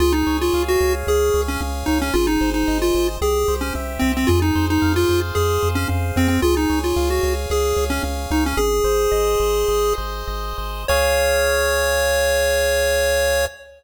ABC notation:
X:1
M:4/4
L:1/16
Q:1/4=112
K:Db
V:1 name="Lead 1 (square)"
F E2 F2 G2 z A3 D z2 E D | F E2 E2 F2 z A3 D z2 C C | F E2 E2 F2 z A3 D z2 C C | F E2 F2 G2 z A3 D z2 E D |
"^rit." A10 z6 | d16 |]
V:2 name="Lead 1 (square)"
A2 d2 f2 d2 A2 d2 f2 d2 | A2 c2 e2 c2 =G2 c2 =e2 c2 | A2 c2 f2 c2 A2 c2 f2 c2 | A2 d2 f2 d2 A2 d2 f2 d2 |
"^rit." A2 c2 e2 c2 A2 c2 e2 c2 | [Adf]16 |]
V:3 name="Synth Bass 1" clef=bass
D,,2 D,,2 D,,2 D,,2 D,,2 D,,2 D,,2 D,,2 | A,,,2 A,,,2 A,,,2 A,,,2 C,,2 C,,2 C,,2 C,,2 | F,,2 F,,2 F,,2 F,,2 F,,2 F,,2 F,,2 F,,2 | D,,2 D,,2 D,,2 D,,2 D,,2 D,,2 D,,2 D,,2 |
"^rit." A,,,2 A,,,2 A,,,2 A,,,2 A,,,2 A,,,2 A,,,2 A,,,2 | D,,16 |]